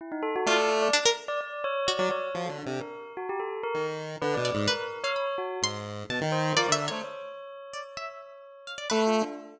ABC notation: X:1
M:5/4
L:1/16
Q:1/4=128
K:none
V:1 name="Lead 1 (square)"
z4 A,4 z9 ^F, z2 | (3F,2 D,2 C,2 z8 ^D,4 (3=D,2 B,,2 ^G,,2 | z8 ^G,,4 B,, ^D,3 F, =D,2 A, | z16 A,3 z |]
V:2 name="Tubular Bells"
E ^D A ^F =d3 d z3 d d2 ^c2 d d c2 | ^F A D2 ^A3 F G =A2 ^A2 z3 B d d2 | ^A3 ^c3 ^F2 z6 =c2 A d2 c | ^c16 (3A2 F2 D2 |]
V:3 name="Harpsichord"
z4 F4 D ^A z6 ^F4 | z18 d2 | B3 f b z3 c'4 a4 (3d2 e2 ^c2 | z6 d z e4 z2 f d B2 z2 |]